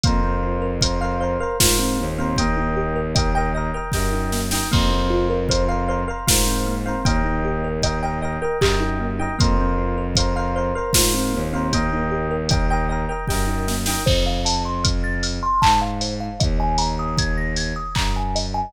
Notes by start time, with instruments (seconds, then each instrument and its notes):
0.03 violin F2, kalimba A#3, electric piano 1 A#4 C5 F5, kick, closed hi-hat
0.23 kalimba C4
0.43 kalimba F4
0.62 kalimba A#4
0.81 electric piano 1 A#4 C5 F5, kalimba C5, kick, closed hi-hat
1.01 electric piano 1 A#4 C5 F5, kalimba F5
1.20 electric piano 1 A#4 C5 F5, kalimba C5
1.40 kalimba A#4, electric piano 1 A#4 C5 F5
1.60 violin G#2, kalimba F4, electric piano 1 A#4 C5 F5, kick, snare
1.79 kalimba C4
1.98 violin D#2, kalimba A#3
2.18 kalimba C4, electric piano 1 A#4 C5 F5
2.36 kalimba A#3, electric piano 1 D#5 G5, kick, closed hi-hat
2.40 electric piano 1 A#4
2.57 kalimba D#4
2.76 kalimba G4
2.96 kalimba A#4
3.15 electric piano 1 A#4 D#5 G5, kalimba D#5, kick, closed hi-hat
3.35 electric piano 1 A#4 D#5 G5, kalimba G5
3.55 electric piano 1 A#4 D#5 G5, kalimba D#5
3.74 kalimba A#4, electric piano 1 A#4 D#5 G5
3.92 violin F#2, kalimba G4, electric piano 1 D#5 G5, kick, snare
3.96 electric piano 1 A#4
4.12 kalimba D#4
4.32 kalimba A#3, snare
4.51 kalimba D#4, electric piano 1 A#4 D#5 G5, snare
4.71 violin F2, kalimba A#3, electric piano 1 A#4 C5 F5, kick, crash
4.91 kalimba C4
5.10 kalimba F4
5.30 kalimba A#4
5.49 electric piano 1 A#4 C5 F5, kalimba C5, kick, closed hi-hat
5.68 electric piano 1 A#4 C5 F5, kalimba F5
5.88 electric piano 1 A#4 C5 F5, kalimba C5
6.08 kalimba A#4, electric piano 1 A#4 C5 F5
6.27 violin G#2, kalimba F4, electric piano 1 A#4 C5 F5, kick, snare
6.47 kalimba C4
6.67 kalimba A#3
6.86 kalimba C4, electric piano 1 A#4 C5 F5
7.05 violin D#2, kalimba A#3, electric piano 1 A#4 D#5 G5, kick, closed hi-hat
7.25 kalimba D#4
7.44 kalimba G4
7.64 kalimba A#4
7.82 electric piano 1 A#4 D#5 G5, kalimba D#5, kick, closed hi-hat
8.03 electric piano 1 A#4 D#5 G5, kalimba G5
8.22 electric piano 1 A#4 D#5 G5, kalimba D#5
8.42 kalimba A#4, electric piano 1 A#4 D#5 G5
8.61 violin F#2, kalimba G4, electric piano 1 A#4 D#5 G5, kick, clap
8.81 kalimba D#4
9.00 kalimba A#3
9.19 kalimba D#4, electric piano 1 A#4 D#5 G5
9.38 violin F2, kalimba A#3, electric piano 1 A#4 C5 F5, kick, closed hi-hat
9.58 kalimba C4
9.78 kalimba F4
9.98 kalimba A#4
10.15 kalimba C5, electric piano 1 C5 F5, kick, closed hi-hat
10.20 electric piano 1 A#4
10.36 electric piano 1 A#4 C5 F5, kalimba F5
10.56 electric piano 1 A#4 C5 F5, kalimba C5
10.75 kalimba A#4, electric piano 1 A#4 C5 F5
10.93 violin G#2, kalimba F4, electric piano 1 C5 F5, kick, snare
10.97 electric piano 1 A#4
11.14 kalimba C4
11.33 violin D#2, kalimba A#3
11.53 kalimba C4, electric piano 1 A#4 C5 F5
11.73 kalimba A#3, electric piano 1 A#4 D#5 G5, kick, closed hi-hat
11.93 kalimba D#4
12.11 kalimba G4
12.31 kalimba A#4
12.49 kalimba D#5, electric piano 1 D#5 G5, kick, closed hi-hat
12.53 electric piano 1 A#4
12.70 electric piano 1 A#4 D#5 G5, kalimba G5
12.89 electric piano 1 A#4 D#5 G5, kalimba D#5
13.09 kalimba A#4, electric piano 1 A#4 D#5 G5
13.27 violin F#2, kalimba G4, electric piano 1 A#4 D#5 G5, kick, snare
13.47 kalimba D#4
13.68 kalimba A#3, snare
13.86 kalimba D#4, electric piano 1 A#4 D#5 G5, snare
14.06 violin F2, kalimba C5, kick, crash
14.26 kalimba F5
14.45 kalimba A5, open hi-hat
14.65 kalimba C6
14.84 kalimba F6, kick, closed hi-hat
15.04 kalimba A6
15.23 kalimba F6, open hi-hat
15.43 kalimba C6
15.62 violin G#2, kalimba A5, kick, clap
15.81 kalimba F5
16.01 kalimba C5, open hi-hat
16.20 kalimba F5
16.40 violin D#2, kalimba D#5, kick, closed hi-hat
16.60 kalimba G#5
16.78 kalimba A#5, open hi-hat
16.99 kalimba D#6
17.18 kalimba G#6, kick, closed hi-hat
17.38 kalimba A#6
17.56 kalimba G#6, open hi-hat
17.76 kalimba D#6
17.95 violin F#2, kalimba A#5, kick, clap
18.16 kalimba G#5
18.35 kalimba D#5, open hi-hat
18.54 kalimba G#5